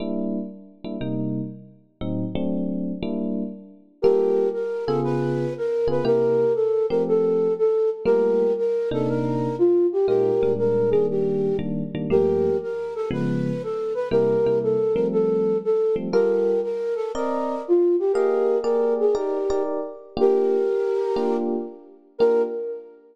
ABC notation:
X:1
M:4/4
L:1/8
Q:"Swing" 1/4=119
K:Gm
V:1 name="Flute"
z8 | z8 | [GB]2 B A _c2 B c | [GB]2 A B A2 A z |
[GB]2 B A B2 F G | [GB]2 B _A G2 z2 | [GB]2 B A _c2 A c | [GB]2 A B A2 A z |
[GB]2 B A B2 F G | [GB]2 B _A G2 z2 | [K:Bb] [GB]5 z3 | B2 z6 |]
V:2 name="Electric Piano 1"
[G,B,D=E]3 [G,B,DE] [C,G,B,_E]4 | [A,,_G,CE] [^F,A,CD]3 [=G,B,D=E]4 | [G,B,FA]3 [_D,_CF_A]4 [D,CFA] | [C,B,=EG]3 [F,A,CG]5 |
[G,A,B,F]3 [C,B,DE]5 | [B,,_A,EF] [B,,G,A,D]2 [E,G,B,D]3 [E,G,B,D] [E,G,B,D] | [G,,F,A,B,]4 [_D,F,_A,_C]4 | [C,G,B,=E] [C,G,B,E]2 [F,G,A,C]4 [F,G,A,C] |
[G,FAB]4 [CBde]4 | [B,_Aef]2 [B,GAd]2 [EGBd] [EGBd]3 | [K:Bb] [B,DFG]4 [B,DFG]4 | [B,DFG]2 z6 |]